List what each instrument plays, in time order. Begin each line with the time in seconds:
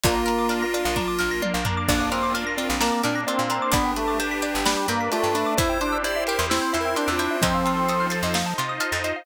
0.04 electric bass (finger) A#1, drawbar organ A#3, pad 5 (bowed) D4 F4 A#4, pizzicato strings D4, lead 1 (square) F4, xylophone D5, kick, closed hi-hat
0.16 xylophone F5
0.26 pizzicato strings A#4, xylophone A#5, closed hi-hat
0.39 xylophone D6
0.49 pizzicato strings D4, xylophone F6, closed hi-hat
0.62 xylophone A#6
0.74 pizzicato strings F4, xylophone D5, closed hi-hat
0.85 electric bass (finger) A#1, xylophone F5
0.96 pad 5 (bowed) A#3 D4 A#4, pizzicato strings D4, xylophone A#5, kick, high tom
1.08 xylophone D6
1.19 electric bass (finger) A#1, pizzicato strings A#4, xylophone F6
1.31 xylophone A#6
1.42 pizzicato strings F4, xylophone D5, high tom
1.54 electric bass (finger) A#1, xylophone F5
1.65 pizzicato strings D4, xylophone A#5, floor tom
1.77 xylophone D6
1.88 electric bass (finger) A#1, lead 1 (square) A#3, pizzicato strings D4, drawbar organ D4, pad 5 (bowed) D4 F4 A#4, xylophone D5, kick, crash
2.01 xylophone F5
2.12 drawbar organ C4, pizzicato strings A#4, xylophone A#5, closed hi-hat
2.23 xylophone D6
2.34 pizzicato strings D4, xylophone F6, closed hi-hat
2.47 xylophone A#6
2.57 lead 1 (square) C4, pizzicato strings F4, xylophone D5, closed hi-hat
2.69 electric bass (finger) A#1, xylophone F5
2.81 drawbar organ A#3, pad 5 (bowed) A#3 D4 A#4, pizzicato strings D4, xylophone A#5, snare
2.92 xylophone D6
3.03 electric bass (finger) A#2, drawbar organ D4, pizzicato strings A#4, xylophone F6, closed hi-hat
3.15 xylophone A#6
3.27 drawbar organ C4, pizzicato strings F4, xylophone D5, closed hi-hat
3.39 electric bass (finger) A#2, xylophone F5
3.50 pizzicato strings D4, xylophone A#5, closed hi-hat
3.62 xylophone D6
3.72 electric bass (finger) G1, drawbar organ B3, pizzicato strings D4, pad 5 (bowed) D4 G4 B4, lead 1 (square) D4, xylophone D5, kick, closed hi-hat
3.85 xylophone G5
3.96 drawbar organ A3, pizzicato strings B4, xylophone B5, closed hi-hat
4.08 xylophone D6
4.20 pizzicato strings D4, xylophone G6, closed hi-hat
4.31 xylophone B6
4.42 pizzicato strings G4, xylophone D5, closed hi-hat
4.54 electric bass (finger) G1, xylophone G5
4.65 drawbar organ G3, pizzicato strings D4, pad 5 (bowed) D4 B4 D5, xylophone B5, snare
4.77 xylophone D6
4.88 electric bass (finger) G2, drawbar organ A#3, pizzicato strings B4, xylophone G6, closed hi-hat
5.00 xylophone B6
5.12 drawbar organ A3, lead 1 (square) F4, pizzicato strings G4, xylophone D5, closed hi-hat
5.23 electric bass (finger) G2, xylophone G5
5.35 pizzicato strings D4, lead 1 (square) D4, xylophone B5, closed hi-hat
5.46 xylophone D6
5.57 electric bass (finger) E2, drawbar organ E4, pad 5 (bowed) E4 G4 C5, pizzicato strings E4, lead 1 (square) C5, xylophone E5, kick, closed hi-hat
5.69 xylophone G5
5.81 drawbar organ D4, pizzicato strings C5, xylophone C6, closed hi-hat
5.92 xylophone E6
6.04 pizzicato strings E4, lead 1 (square) D5, xylophone G6, closed hi-hat
6.16 xylophone E5
6.27 pizzicato strings G4, lead 1 (square) A#4, xylophone G5, closed hi-hat
6.39 electric bass (finger) E2, xylophone C6
6.49 pad 5 (bowed) C4 E4 C5, drawbar organ C4, lead 1 (square) E4, pizzicato strings E4, xylophone E6, snare
6.62 xylophone G6
6.73 electric bass (finger) E2, drawbar organ E4, pizzicato strings C5, xylophone E5, closed hi-hat
6.81 lead 1 (square) A#4
6.85 xylophone G5
6.96 drawbar organ D4, pizzicato strings G4, xylophone C6, closed hi-hat
7.08 electric bass (finger) E2, xylophone E6
7.12 lead 1 (square) F4
7.19 pizzicato strings E4, xylophone G6, closed hi-hat
7.31 xylophone E5
7.42 electric bass (finger) F2, lead 1 (square) F3, drawbar organ C4, pad 5 (bowed) D#4 F4 A4 C5, pizzicato strings D#4, xylophone D#5, kick, closed hi-hat
7.54 xylophone F5
7.65 pizzicato strings F4, xylophone A5, closed hi-hat
7.77 xylophone C6
7.89 pizzicato strings A4, xylophone D#6, closed hi-hat
8.00 xylophone F6
8.10 pizzicato strings C5, xylophone A6, closed hi-hat
8.23 electric bass (finger) F2, xylophone D#5
8.34 pizzicato strings D#4, pad 5 (bowed) D#4 F4 C5 D#5, xylophone F5, snare
8.46 xylophone A5
8.58 electric bass (finger) C3, pizzicato strings F4, xylophone C6, closed hi-hat
8.69 xylophone D#6
8.80 pizzicato strings A4, xylophone F6, closed hi-hat
8.92 electric bass (finger) F2, xylophone A6
9.04 pizzicato strings C5, xylophone D#5, closed hi-hat
9.16 xylophone F5